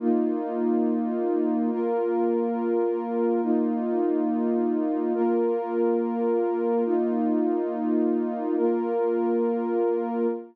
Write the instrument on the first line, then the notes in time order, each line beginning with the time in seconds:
pad 2 (warm)
0.00 A#3 D#4 F4
1.71 A#3 F4 A#4
3.43 A#3 D#4 F4
5.14 A#3 F4 A#4
6.86 A#3 D#4 F4
8.57 A#3 F4 A#4